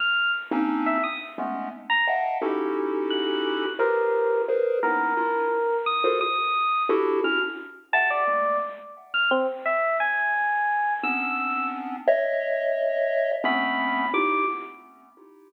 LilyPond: <<
  \new Staff \with { instrumentName = "Lead 1 (square)" } { \time 7/8 \tempo 4 = 87 r8. <bes c' des' d' ees'>8. r8 <aes a b des'>8 r8 <ees'' e'' f'' ges'' g'' a''>8 | <des' ees' e' ges' g' a'>2 <f' g' aes' bes' b' c''>4 <aes' bes' b' c''>8 | <bes b des' ees' e'>8 <d' e' f'>8 r8. <f' ges' aes' a' bes' c''>16 r4 <d' e' ges' g' a'>8 | <des' d' e' ges'>16 r8. <e'' ges'' g''>8 <aes a bes>8 r4. |
r2 <b c' des' d'>4. | <des'' ees'' e''>2 <a b c' des'>4 <ees' e' f' g'>8 | }
  \new Staff \with { instrumentName = "Electric Piano 1" } { \time 7/8 f'''8 r8. e''16 ees'''16 r4 bes''16 r8 | r4 ges'''4 bes'4 r8 | bes'4. ees'''8 ees'''4 r8 | f'''16 r8. a''16 d''8. r8. f'''16 c'16 r16 |
e''8 aes''4. e'''4 r8 | r2 b''4 d'''8 | }
>>